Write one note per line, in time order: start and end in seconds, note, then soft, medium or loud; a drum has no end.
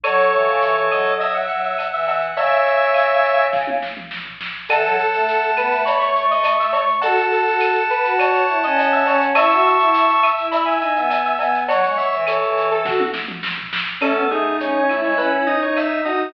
0.03 0.31 F#3 loud
0.03 1.11 A4 loud
0.03 0.31 C#5 medium
0.03 1.11 C#5 loud
0.03 cowbell loud
0.03 claves loud
0.03 shaker loud
0.18 shaker medium
0.32 0.47 E3 medium
0.32 0.82 C#5 medium
0.32 shaker medium
0.46 0.60 C#3 medium
0.46 shaker medium
0.61 0.75 E3 medium
0.61 shaker loud
0.75 0.89 E3 medium
0.75 shaker medium
0.91 1.47 F#3 medium
0.91 1.16 D#5 medium
0.91 claves loud
0.91 shaker medium
1.05 shaker medium
1.20 1.34 D#5 loud
1.20 1.33 E5 medium
1.20 cowbell medium
1.20 shaker loud
1.34 1.61 E5 medium
1.34 1.48 F#5 medium
1.34 shaker medium
1.48 1.74 F#3 medium
1.48 2.05 F#5 medium
1.48 shaker medium
1.63 1.87 E5 medium
1.63 shaker medium
1.78 cowbell medium
1.78 claves medium
1.78 shaker loud
1.92 2.31 E3 medium
1.92 2.07 E5 medium
1.92 shaker medium
2.07 2.22 E5 medium
2.07 2.33 F#5 loud
2.07 cowbell medium
2.07 shaker medium
2.21 shaker medium
2.36 3.75 C#3 loud
2.36 3.44 C#5 loud
2.36 3.44 E5 loud
2.36 2.63 E5 medium
2.36 cowbell loud
2.36 shaker loud
2.51 shaker medium
2.66 3.48 E5 medium
2.66 shaker medium
2.81 shaker medium
2.94 claves loud
2.94 shaker loud
3.09 shaker medium
3.24 shaker medium
3.39 shaker medium
3.53 kick loud
3.53 snare medium
3.67 high tom medium
3.82 snare medium
3.97 mid tom medium
4.11 snare loud
4.25 floor tom medium
4.41 snare loud
4.68 4.85 E3 medium
4.68 4.96 A4 medium
4.68 5.83 F#5 loud
4.68 5.83 A5 loud
4.68 cowbell loud
4.68 claves loud
4.68 shaker loud
4.84 4.98 F#3 loud
4.84 shaker loud
4.98 5.51 A4 medium
4.98 shaker loud
5.13 5.54 A3 medium
5.13 shaker loud
5.28 shaker loud
5.43 shaker medium
5.56 5.70 B3 medium
5.56 5.82 B4 medium
5.56 claves loud
5.56 shaker loud
5.71 6.85 A3 medium
5.71 shaker medium
5.85 5.99 C#5 medium
5.85 6.00 B5 loud
5.85 cowbell loud
5.85 shaker loud
6.00 6.25 C#5 medium
6.00 6.13 C#6 loud
6.00 shaker loud
6.15 6.64 C#6 loud
6.15 shaker loud
6.30 6.54 D#5 medium
6.30 shaker medium
6.43 cowbell loud
6.43 claves loud
6.43 shaker loud
6.59 6.73 E5 medium
6.59 shaker loud
6.72 6.86 C#5 medium
6.72 6.99 C#6 loud
6.72 cowbell loud
6.72 shaker loud
6.88 shaker medium
7.01 7.17 F#4 loud
7.01 7.27 A4 medium
7.01 9.23 F#5 loud
7.01 9.23 A5 loud
7.01 cowbell loud
7.01 shaker loud
7.17 7.42 F#4 medium
7.17 shaker loud
7.31 7.83 A4 medium
7.31 shaker medium
7.46 7.76 F#4 medium
7.46 shaker medium
7.60 claves loud
7.60 shaker loud
7.75 shaker medium
7.89 8.14 B4 medium
7.89 shaker medium
8.04 8.42 F#4 medium
8.04 shaker loud
8.18 8.32 C#5 medium
8.18 cowbell loud
8.18 claves loud
8.18 shaker loud
8.33 8.58 C#5 medium
8.33 shaker loud
8.47 8.62 E4 medium
8.47 shaker medium
8.63 9.03 C#4 medium
8.63 8.92 D#5 medium
8.63 shaker loud
8.76 cowbell loud
8.76 shaker loud
8.92 9.06 E5 medium
8.92 shaker medium
9.06 9.31 C#4 medium
9.06 9.20 C#5 medium
9.06 cowbell loud
9.06 shaker loud
9.21 shaker loud
9.35 9.50 E4 loud
9.35 9.63 E5 medium
9.35 10.29 A5 loud
9.35 10.29 C#6 loud
9.35 cowbell loud
9.35 claves loud
9.35 shaker loud
9.50 9.76 F#4 medium
9.50 shaker loud
9.65 10.20 E5 medium
9.65 shaker medium
9.79 10.04 E4 medium
9.79 shaker medium
9.94 shaker loud
10.08 shaker medium
10.22 10.48 E5 medium
10.22 claves loud
10.22 shaker loud
10.37 10.77 E4 medium
10.37 shaker medium
10.51 10.66 E5 medium
10.51 10.65 B5 loud
10.51 cowbell loud
10.51 shaker loud
10.65 10.93 E5 medium
10.65 10.79 G#5 loud
10.65 shaker medium
10.80 10.94 D#4 medium
10.80 11.33 G#5 loud
10.80 shaker medium
10.96 11.34 B3 medium
10.96 11.21 E5 medium
10.96 shaker medium
11.10 cowbell medium
11.10 claves loud
11.10 shaker loud
11.24 11.39 E5 medium
11.24 shaker medium
11.39 11.67 B3 medium
11.39 11.54 E5 medium
11.39 11.64 G#5 loud
11.39 cowbell loud
11.39 shaker loud
11.54 shaker loud
11.68 11.84 F#3 loud
11.68 12.15 C#5 medium
11.68 11.95 F#5 loud
11.68 cowbell loud
11.68 shaker loud
11.83 11.98 G#3 medium
11.83 shaker medium
11.97 12.24 E5 loud
11.97 shaker loud
12.12 12.37 E3 loud
12.12 shaker medium
12.27 13.01 A4 loud
12.27 12.69 C#5 medium
12.27 claves loud
12.27 shaker loud
12.42 12.85 E3 medium
12.42 shaker medium
12.57 shaker loud
12.70 12.85 A4 medium
12.70 shaker medium
12.85 13.09 F#4 medium
12.85 kick loud
12.85 snare loud
13.00 high tom loud
13.13 snare loud
13.28 mid tom loud
13.43 snare loud
13.58 floor tom loud
13.73 snare loud
14.01 14.16 A3 medium
14.01 14.24 C#4 medium
14.01 14.27 A4 loud
14.01 crash loud
14.01 cowbell loud
14.01 claves loud
14.15 14.28 B3 medium
14.30 14.57 A3 medium
14.30 14.81 D#4 medium
14.30 14.56 G#4 loud
14.30 shaker medium
14.60 14.73 C#4 medium
14.60 14.99 C#5 medium
14.60 shaker loud
14.74 14.87 C#4 medium
14.89 15.03 A3 medium
14.89 15.45 E4 medium
14.89 claves medium
14.89 shaker medium
15.03 15.17 G#3 medium
15.03 15.18 C#5 loud
15.17 15.53 C#4 medium
15.17 15.31 B4 loud
15.17 cowbell medium
15.17 shaker loud
15.46 16.01 D#4 medium
15.46 15.60 D#5 loud
15.46 shaker medium
15.62 15.99 D#4 medium
15.62 15.76 C#5 loud
15.76 16.01 E5 loud
15.76 cowbell medium
15.76 claves medium
15.76 shaker loud
16.04 16.31 D#4 medium
16.04 16.28 F#4 medium
16.04 16.29 D#5 loud
16.04 cowbell medium
16.04 shaker medium